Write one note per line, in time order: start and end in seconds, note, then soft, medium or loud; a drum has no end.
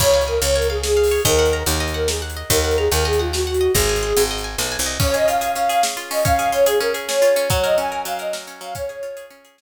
0.00 0.38 C#2 medium
0.00 0.24 C#5 medium
0.00 0.55 C#5 medium
0.00 kick medium
0.00 crash loud
0.13 0.41 F5 medium
0.21 closed hi-hat medium
0.27 0.39 A#4 medium
0.27 0.83 G#5 medium
0.42 1.18 C#2 medium
0.42 0.54 C#5 medium
0.42 0.69 F5 medium
0.42 closed hi-hat medium
0.55 0.67 A#4 medium
0.55 1.11 C#5 medium
0.62 closed hi-hat medium
0.70 0.82 G#4 medium
0.70 0.96 F5 medium
0.83 1.21 G#4 medium
0.83 1.23 G#5 medium
0.83 snare loud
0.97 1.23 F5 medium
1.03 open hi-hat medium
1.11 1.25 C#5 medium
1.25 1.63 D#2 loud
1.25 1.60 A#4 medium
1.25 1.80 D#5 medium
1.25 kick loud
1.25 closed hi-hat medium
1.39 1.66 F#5 medium
1.46 closed hi-hat medium
1.53 2.08 A#5 medium
1.66 2.43 D#2 loud
1.66 1.94 F#5 medium
1.66 closed hi-hat loud
1.80 2.36 D#5 medium
1.88 closed hi-hat medium
1.94 2.07 A#4 medium
1.94 2.22 F#5 medium
2.08 2.21 G#4 medium
2.08 2.48 A#5 medium
2.08 snare loud
2.22 2.48 F#5 medium
2.30 closed hi-hat medium
2.37 2.50 D#5 medium
2.50 2.88 D#2 loud
2.50 2.76 A#4 medium
2.50 3.05 D#5 medium
2.50 kick medium
2.50 closed hi-hat loud
2.64 2.91 F#5 medium
2.71 closed hi-hat medium
2.77 2.89 G#4 medium
2.77 3.33 A#5 medium
2.91 3.68 D#2 medium
2.91 3.04 A#4 medium
2.91 3.19 F#5 medium
2.91 closed hi-hat medium
3.05 3.19 G#4 medium
3.05 3.60 D#5 medium
3.13 closed hi-hat medium
3.19 3.31 F4 medium
3.19 3.46 F#5 medium
3.33 3.72 F#4 medium
3.33 3.73 A#5 medium
3.33 snare loud
3.47 3.73 F#5 medium
3.54 closed hi-hat medium
3.61 3.74 D#5 medium
3.75 4.13 G#1 loud
3.75 4.22 G#4 medium
3.75 4.30 D#5 medium
3.75 kick medium
3.75 closed hi-hat medium
3.89 4.16 G#5 medium
3.96 closed hi-hat medium
4.03 4.58 C6 medium
4.17 4.56 G#1 medium
4.17 4.44 G#5 medium
4.17 closed hi-hat loud
4.31 4.86 D#5 medium
4.38 closed hi-hat medium
4.44 4.71 G#5 medium
4.58 4.77 B1 medium
4.58 4.98 C6 medium
4.58 snare loud
4.72 4.98 G#5 medium
4.79 4.98 C2 medium
4.79 closed hi-hat medium
4.86 4.99 D#5 medium
5.00 5.55 C#4 medium
5.00 5.13 C#5 medium
5.00 kick loud
5.00 crash loud
5.14 5.41 G#4 medium
5.14 5.26 D#5 medium
5.14 closed hi-hat medium
5.27 5.96 F4 medium
5.27 5.50 F5 medium
5.27 closed hi-hat medium
5.41 5.69 G#4 medium
5.41 closed hi-hat medium
5.55 6.10 C#4 medium
5.55 5.68 F5 medium
5.55 closed hi-hat medium
5.69 5.83 G#4 medium
5.69 5.81 F5 medium
5.69 closed hi-hat medium
5.83 6.23 G#4 medium
5.83 snare loud
5.97 6.23 F4 medium
5.97 closed hi-hat medium
6.11 6.24 C#4 medium
6.11 6.24 D#5 medium
6.11 open hi-hat medium
6.25 6.80 C#4 medium
6.25 6.49 F5 medium
6.25 kick loud
6.25 closed hi-hat medium
6.39 6.66 G#4 medium
6.39 closed hi-hat medium
6.52 7.21 F4 medium
6.52 6.65 C#5 medium
6.52 closed hi-hat medium
6.66 6.94 G#4 medium
6.66 6.78 G#4 medium
6.66 closed hi-hat loud
6.80 7.36 C#4 medium
6.80 6.93 A#4 medium
6.80 closed hi-hat medium
6.94 7.08 G#4 medium
6.94 closed hi-hat medium
7.08 7.48 G#4 medium
7.08 7.49 C#5 medium
7.08 snare loud
7.22 7.48 F4 medium
7.22 closed hi-hat medium
7.36 7.50 C#4 medium
7.36 closed hi-hat medium
7.50 8.05 F#3 medium
7.50 7.63 C#5 medium
7.50 kick loud
7.50 closed hi-hat medium
7.64 7.91 A#4 medium
7.64 7.76 D#5 medium
7.64 closed hi-hat medium
7.77 8.47 C#4 medium
7.77 8.01 G#5 medium
7.77 closed hi-hat medium
7.92 8.19 A#4 medium
8.05 8.60 F#3 medium
8.05 8.18 F5 medium
8.05 closed hi-hat loud
8.19 8.33 A#4 medium
8.19 8.33 D#5 medium
8.19 closed hi-hat medium
8.33 8.73 A#4 medium
8.33 snare loud
8.47 8.74 C#4 medium
8.47 closed hi-hat medium
8.61 8.74 F#3 medium
8.61 8.73 F5 medium
8.61 closed hi-hat medium
8.75 9.30 C#4 medium
8.75 9.25 C#5 medium
8.75 kick loud
8.75 closed hi-hat loud
8.89 9.16 G#4 medium
8.89 closed hi-hat medium
9.03 9.61 F4 medium
9.03 closed hi-hat medium
9.17 9.44 G#4 medium
9.17 closed hi-hat medium
9.30 9.61 C#4 medium
9.30 closed hi-hat medium
9.45 9.58 G#4 medium
9.45 closed hi-hat medium
9.58 9.61 G#4 medium
9.58 snare loud